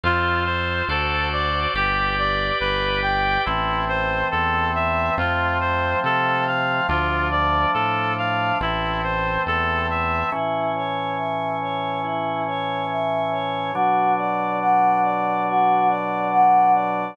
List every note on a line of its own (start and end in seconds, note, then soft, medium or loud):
0.04 0.83 F2 loud
0.04 0.88 F4 medium
0.04 0.44 F4 medium
0.04 0.88 A4 medium
0.04 0.88 C5 medium
0.45 0.85 C5 medium
0.88 1.67 D2 loud
0.88 1.74 F#4 medium
0.88 1.74 A4 medium
0.88 1.29 A4 medium
0.88 1.74 C5 medium
0.88 1.74 D5 medium
1.32 1.72 D5 medium
1.74 2.51 G1 loud
1.74 3.45 G4 medium
1.74 2.15 G4 medium
1.74 3.45 B4 medium
1.74 3.45 D5 medium
2.19 2.58 D5 medium
2.60 3.38 G1 medium
2.60 3.00 B4 medium
3.03 3.42 G5 medium
3.45 4.24 A1 loud
3.45 5.16 E3 medium
3.45 5.16 A3 medium
3.45 5.16 C4 medium
3.45 3.85 E4 medium
3.88 4.28 C5 medium
4.31 5.10 E2 medium
4.31 4.71 A4 medium
4.75 5.15 E5 medium
5.18 5.95 F2 loud
5.18 6.87 F3 medium
5.18 6.87 A3 medium
5.18 6.87 C4 medium
5.18 5.58 F4 medium
5.60 6.00 C5 medium
6.04 6.81 C3 medium
6.04 6.44 A4 medium
6.47 6.87 F5 medium
6.89 7.66 D2 loud
6.89 8.59 F3 medium
6.89 8.59 A3 medium
6.89 8.59 D4 medium
6.89 7.28 F4 medium
7.31 7.71 D5 medium
7.74 8.52 A2 medium
7.74 8.14 A4 medium
8.18 8.58 F5 medium
8.61 9.38 A1 medium
8.61 10.30 E3 medium
8.61 10.30 A3 medium
8.61 10.30 C4 medium
8.61 9.01 E4 medium
9.03 9.43 C5 medium
9.46 10.23 E2 medium
9.46 9.87 A4 medium
9.90 10.30 E5 medium
10.32 13.72 A2 medium
10.32 13.72 E3 medium
10.32 13.72 C#4 medium
10.32 10.72 E4 medium
10.76 11.15 C#5 medium
11.17 11.56 E5 medium
11.61 12.01 C#5 medium
12.03 12.43 E4 medium
12.47 12.87 C#5 medium
12.89 13.29 E5 medium
13.31 13.71 C#5 medium
13.74 17.14 B2 medium
13.74 17.14 F#3 medium
13.74 17.14 D4 medium
13.74 14.14 F#4 medium
14.18 14.57 D5 medium
14.60 15.00 F#5 medium
15.03 15.43 D5 medium
15.48 15.87 F#4 medium
15.89 16.28 D5 medium
16.31 16.71 F#5 medium
16.74 17.13 D5 medium